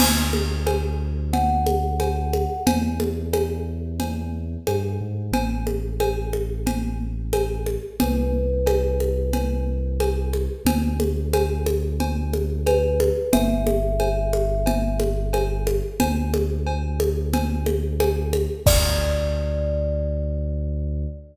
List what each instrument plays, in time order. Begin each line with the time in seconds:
0.00 synth bass 2 D2, crash, cowbell, low conga
0.33 high conga
0.67 cowbell, high conga
1.33 kalimba F#5, cowbell, low conga
1.67 high conga
2.00 cowbell, high conga
2.33 high conga
2.67 synth bass 2 E2, cowbell, low conga
3.00 high conga
3.33 cowbell, high conga
4.00 cowbell, low conga
4.67 synth bass 2 G2, cowbell, high conga
5.01 synth bass 2 G#2
5.32 synth bass 2 A1, cowbell, low conga
5.67 high conga
6.00 cowbell, high conga
6.33 high conga
6.67 cowbell, low conga
7.33 cowbell, high conga
7.66 high conga
8.00 synth bass 2 C2, kalimba B4, cowbell, low conga
8.66 cowbell, high conga
9.00 high conga
9.33 cowbell, low conga
10.00 cowbell, high conga
10.33 high conga
10.65 synth bass 2 D2, cowbell, low conga
11.00 high conga
11.33 cowbell, high conga
11.66 high conga
12.00 cowbell, low conga
12.33 high conga
12.66 kalimba B4, cowbell, high conga
13.00 high conga
13.33 synth bass 2 G1, kalimba E5, cowbell, low conga
13.67 high conga
14.00 cowbell, high conga
14.33 high conga
14.66 cowbell, low conga
15.00 high conga
15.33 cowbell, high conga
15.67 high conga
16.00 synth bass 2 D2, cowbell, low conga
16.34 high conga
16.67 cowbell
17.00 high conga
17.33 cowbell, low conga
17.66 high conga
18.00 cowbell, high conga
18.33 high conga
18.66 synth bass 2 D2, kalimba D5, kick, crash